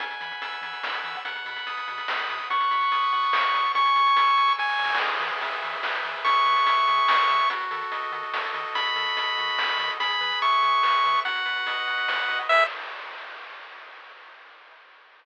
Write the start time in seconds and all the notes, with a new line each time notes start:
0.00 E2 F#5 G#5, kick, closed hi-hat
0.11 closed hi-hat
0.21 E3 B5, closed hi-hat
0.31 closed hi-hat
0.42 E2 E6, closed hi-hat
0.52 closed hi-hat
0.61 E3 G#5, closed hi-hat
0.73 closed hi-hat
0.83 E2 B5, snare
0.94 closed hi-hat
1.04 E3 E6, closed hi-hat
1.15 closed hi-hat
1.25 B1 F#5, kick, closed hi-hat
1.35 closed hi-hat
1.45 B2 B5, closed hi-hat
1.56 closed hi-hat
1.67 B1 D#6, closed hi-hat
1.77 closed hi-hat
1.88 B2 F#5, closed hi-hat
1.98 closed hi-hat
2.07 B1 B5, snare
2.19 closed hi-hat
2.28 B2 D#6, closed hi-hat
2.40 closed hi-hat
2.50 B1 F#5 C#6, kick, closed hi-hat
2.61 closed hi-hat
2.71 B2 B5, closed hi-hat
2.81 closed hi-hat
2.91 B1 D#6, closed hi-hat
3.02 closed hi-hat
3.13 B2 F#5, closed hi-hat
3.23 closed hi-hat
3.33 B1 B5, snare
3.44 closed hi-hat
3.54 B2 D#6, closed hi-hat
3.65 closed hi-hat
3.75 C#2 G#5 C#6, kick, closed hi-hat
3.85 closed hi-hat
3.96 C#3 C#6, closed hi-hat
4.07 closed hi-hat
4.16 C#2 E6, closed hi-hat
4.27 closed hi-hat
4.38 C#3 G#5, closed hi-hat
4.48 closed hi-hat
4.58 C#2 G#5 C#6, kick, snare
4.69 snare
4.79 C#3 E6, snare
4.84 snare
4.89 snare
4.95 snare
5.00 E2 G#4, kick, crash
5.10 closed hi-hat
5.20 E3 B4, closed hi-hat
5.32 closed hi-hat
5.41 E2 E5, closed hi-hat
5.52 closed hi-hat
5.62 E3 G#4, closed hi-hat
5.73 closed hi-hat
5.83 E2 B4, snare
5.94 closed hi-hat
6.04 E3 E5, closed hi-hat
6.15 closed hi-hat
6.24 E2 G#4 C#6, kick, closed hi-hat
6.35 closed hi-hat
6.45 E3 B4, closed hi-hat
6.56 closed hi-hat
6.66 E2 E5, closed hi-hat
6.77 closed hi-hat
6.87 E3 G#4, closed hi-hat
6.98 closed hi-hat
7.08 E2 B4, snare
7.19 closed hi-hat
7.29 E3 E5, closed hi-hat
7.40 closed hi-hat
7.50 D#2 F#4, kick, closed hi-hat
7.60 closed hi-hat
7.71 D#3 A4, closed hi-hat
7.81 closed hi-hat
7.92 D#2 D#5, closed hi-hat
8.02 closed hi-hat
8.12 D#3 F#4, closed hi-hat
8.23 closed hi-hat
8.33 D#2 A4, snare
8.44 closed hi-hat
8.54 D#3 D#5, closed hi-hat
8.64 closed hi-hat
8.75 D#2 F#4 B5, kick, closed hi-hat
8.86 closed hi-hat
8.95 D#3 A4, closed hi-hat
9.06 closed hi-hat
9.16 D#2 D#5, closed hi-hat
9.27 closed hi-hat
9.37 D#3 F#4, closed hi-hat
9.48 closed hi-hat
9.57 D#2 A4, snare
9.69 closed hi-hat
9.78 D#3 D#5, closed hi-hat
9.90 closed hi-hat
10.00 E2 G#4 B5, kick, closed hi-hat
10.10 closed hi-hat
10.21 E3 B4, closed hi-hat
10.31 closed hi-hat
10.41 E2 E5 C#6, closed hi-hat
10.52 closed hi-hat
10.62 E3 G#4, closed hi-hat
10.73 closed hi-hat
10.83 E2 B4, snare
10.94 closed hi-hat
11.04 E3 E5, closed hi-hat
11.15 closed hi-hat
11.25 B1 F#4 F#5, kick, closed hi-hat
11.35 closed hi-hat
11.46 B2 B4, closed hi-hat
11.56 closed hi-hat
11.66 B1 D#5, closed hi-hat
11.77 closed hi-hat
11.86 B2 F#4, closed hi-hat
11.98 closed hi-hat
12.08 B1 B4, snare
12.19 closed hi-hat
12.29 B2 D#5, closed hi-hat
12.39 closed hi-hat
12.49 E2 G#4 B4 E5, kick, crash